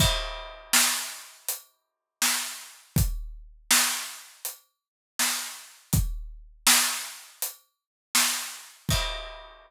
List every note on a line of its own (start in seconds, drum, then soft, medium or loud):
0.00 kick loud
0.00 crash loud
0.73 snare loud
1.48 closed hi-hat loud
2.22 snare loud
2.96 kick loud
2.96 closed hi-hat loud
3.71 snare loud
4.45 closed hi-hat loud
5.19 snare loud
5.93 kick loud
5.93 closed hi-hat loud
6.67 snare loud
7.42 closed hi-hat loud
8.15 snare loud
8.89 kick loud
8.89 crash loud